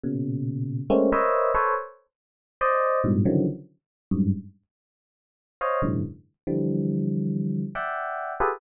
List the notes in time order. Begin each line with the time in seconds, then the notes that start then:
0.04 A#2 B2 C#3
0.90 G#3 A3 A#3 C4 C#4
1.12 A#4 B4 C5 C#5 D#5 E5
1.55 A4 B4 C5 C#5
2.61 C5 D5 D#5
3.04 G2 G#2 A2 B2
3.25 C#3 D3 D#3 E3 F3 F#3
4.11 F#2 G2 G#2
5.61 C5 C#5 D#5 F5
5.82 F#2 G#2 A#2 C3 D3 E3
6.47 D3 E3 F3 G3
7.75 D5 E5 F#5 G5
8.40 F4 G4 G#4 A4 B4